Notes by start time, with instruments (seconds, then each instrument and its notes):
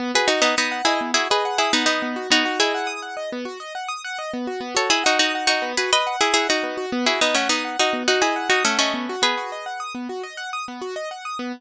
0.00 acoustic grand piano B3
0.15 acoustic grand piano F#4, pizzicato strings G#4 B4
0.28 pizzicato strings D#4 F#4, acoustic grand piano D#5
0.42 pizzicato strings B3 D#4, acoustic grand piano F#5
0.57 pizzicato strings B3 D#4, acoustic grand piano D#6
0.72 acoustic grand piano F#5
0.85 pizzicato strings E4 G#4, acoustic grand piano D#5
1.01 acoustic grand piano B3
1.14 pizzicato strings E4 G#4, acoustic grand piano F#4
1.30 pizzicato strings G#4 B4, acoustic grand piano D#5
1.45 acoustic grand piano F#5
1.58 pizzicato strings E4 G#4, acoustic grand piano D#6
1.73 pizzicato strings B3 D#4, acoustic grand piano F#5
1.86 pizzicato strings B3 D#4, acoustic grand piano D#5
2.02 acoustic grand piano B3
2.16 acoustic grand piano F#4
2.30 acoustic grand piano B3, pizzicato strings D#4 F#4
2.45 acoustic grand piano F#4
2.59 pizzicato strings E4 G#4, acoustic grand piano D#5
2.74 acoustic grand piano F#5
2.87 acoustic grand piano D#6
3.02 acoustic grand piano F#5
3.17 acoustic grand piano D#5
3.32 acoustic grand piano B3
3.45 acoustic grand piano F#4
3.60 acoustic grand piano D#5
3.75 acoustic grand piano F#5
3.88 acoustic grand piano D#6
4.04 acoustic grand piano F#5
4.19 acoustic grand piano D#5
4.34 acoustic grand piano B3
4.47 acoustic grand piano F#4
4.61 acoustic grand piano B3
4.75 acoustic grand piano F#4, pizzicato strings A4 C#5
4.90 pizzicato strings E4 G#4, acoustic grand piano D#5
5.04 pizzicato strings D#4 F#4, acoustic grand piano F#5
5.19 pizzicato strings D#4 F#4, acoustic grand piano D#6
5.35 acoustic grand piano F#5
5.47 pizzicato strings D#4 F#4, acoustic grand piano D#5
5.62 acoustic grand piano B3
5.77 acoustic grand piano F#4, pizzicato strings G#4 B4
5.93 pizzicato strings B4 D#5, acoustic grand piano D#5
6.07 acoustic grand piano F#5
6.21 pizzicato strings E4 G#4, acoustic grand piano D#6
6.34 pizzicato strings E4 G#4, acoustic grand piano F#5
6.49 pizzicato strings D#4 F#4, acoustic grand piano D#5
6.63 acoustic grand piano B3
6.77 acoustic grand piano F#4
6.92 acoustic grand piano B3
7.06 pizzicato strings E4 G#4, acoustic grand piano F#4
7.21 pizzicato strings B3 D#4, acoustic grand piano D#5
7.34 pizzicato strings A3 C#4, acoustic grand piano F#5
7.49 pizzicato strings B3 D#4, acoustic grand piano D#6
7.65 acoustic grand piano F#5
7.79 pizzicato strings D#4 F#4, acoustic grand piano D#5
7.93 acoustic grand piano B3
8.08 pizzicato strings D#4 F#4, acoustic grand piano F#4
8.22 pizzicato strings E4 G#4, acoustic grand piano D#5
8.36 acoustic grand piano F#5
8.50 pizzicato strings D#4 F#4, acoustic grand piano D#6
8.65 pizzicato strings A3 C#4, acoustic grand piano F#5
8.79 pizzicato strings A3 C#4, acoustic grand piano D#5
8.94 acoustic grand piano B3
9.09 acoustic grand piano F#4
9.22 acoustic grand piano B3, pizzicato strings G#4 B4
9.37 acoustic grand piano F#4
9.52 acoustic grand piano D#5
9.66 acoustic grand piano F#5
9.80 acoustic grand piano D#6
9.95 acoustic grand piano B3
10.09 acoustic grand piano F#4
10.23 acoustic grand piano D#5
10.37 acoustic grand piano F#5
10.53 acoustic grand piano D#6
10.68 acoustic grand piano B3
10.81 acoustic grand piano F#4
10.96 acoustic grand piano D#5
11.11 acoustic grand piano F#5
11.25 acoustic grand piano D#6
11.39 acoustic grand piano B3